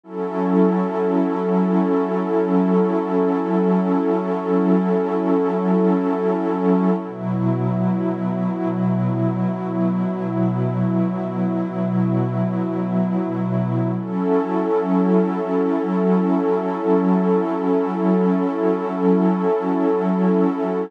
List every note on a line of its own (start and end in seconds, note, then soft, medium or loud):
0.04 6.92 F#3 medium
0.04 6.92 C#4 medium
0.04 6.92 E4 medium
0.04 6.92 A4 medium
7.00 13.89 B2 medium
7.00 13.89 F#3 medium
7.00 13.89 E4 medium
13.96 20.85 F#3 medium
13.96 20.85 C#4 medium
13.96 20.85 E4 medium
13.96 20.85 A4 medium